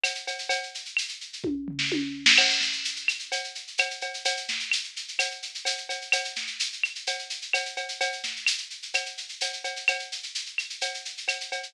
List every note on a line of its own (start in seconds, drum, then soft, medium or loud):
0.04 cowbell medium
0.04 claves medium
0.04 shaker medium
0.15 shaker medium
0.27 cowbell medium
0.27 shaker medium
0.39 shaker medium
0.49 cowbell medium
0.49 shaker medium
0.63 shaker medium
0.75 shaker medium
0.85 shaker medium
0.97 claves medium
0.97 shaker medium
1.08 shaker medium
1.21 shaker medium
1.33 shaker medium
1.44 kick medium
1.44 high tom medium
1.68 floor tom medium
1.79 snare medium
1.92 high tom medium
2.26 snare loud
2.38 crash loud
2.38 cowbell medium
2.38 claves loud
2.50 shaker medium
2.60 snare medium
2.60 shaker medium
2.73 shaker medium
2.85 shaker medium
2.96 shaker medium
3.08 claves medium
3.08 shaker medium
3.19 shaker medium
3.32 cowbell medium
3.32 shaker medium
3.44 shaker medium
3.55 shaker medium
3.67 shaker medium
3.78 cowbell medium
3.78 claves medium
3.78 shaker medium
3.91 shaker medium
4.01 cowbell medium
4.01 shaker medium
4.14 shaker medium
4.25 cowbell medium
4.25 shaker loud
4.37 shaker medium
4.48 snare medium
4.48 shaker medium
4.60 shaker medium
4.71 claves medium
4.71 shaker loud
4.84 shaker medium
4.96 shaker medium
5.08 shaker medium
5.19 cowbell medium
5.19 claves medium
5.19 shaker loud
5.31 shaker medium
5.42 shaker medium
5.54 shaker medium
5.65 cowbell medium
5.65 shaker loud
5.78 shaker medium
5.89 cowbell medium
5.89 shaker medium
6.01 shaker medium
6.12 cowbell medium
6.12 claves medium
6.12 shaker loud
6.24 shaker medium
6.36 snare medium
6.36 shaker medium
6.47 shaker medium
6.60 shaker loud
6.73 shaker medium
6.83 claves medium
6.83 shaker medium
6.95 shaker medium
7.07 cowbell medium
7.07 shaker medium
7.19 shaker medium
7.30 shaker medium
7.42 shaker medium
7.53 cowbell medium
7.53 claves medium
7.53 shaker medium
7.65 shaker medium
7.77 cowbell medium
7.77 shaker medium
7.89 shaker medium
8.01 cowbell medium
8.01 shaker medium
8.12 shaker medium
8.23 snare soft
8.23 shaker medium
8.36 shaker medium
8.46 claves medium
8.46 shaker loud
8.58 shaker medium
8.70 shaker medium
8.82 shaker medium
8.94 cowbell medium
8.94 claves medium
8.94 shaker medium
9.06 shaker medium
9.17 shaker medium
9.29 shaker medium
9.41 cowbell medium
9.41 shaker loud
9.53 shaker medium
9.64 cowbell medium
9.64 shaker medium
9.76 shaker medium
9.88 cowbell medium
9.88 claves medium
9.88 shaker medium
9.99 shaker medium
10.12 shaker medium
10.23 shaker medium
10.35 shaker medium
10.46 shaker medium
10.58 claves medium
10.58 shaker medium
10.70 shaker medium
10.81 cowbell medium
10.81 shaker medium
10.94 shaker medium
11.05 shaker medium
11.17 shaker medium
11.28 cowbell medium
11.28 claves medium
11.28 shaker medium
11.41 shaker medium
11.52 cowbell medium
11.52 shaker medium
11.63 shaker medium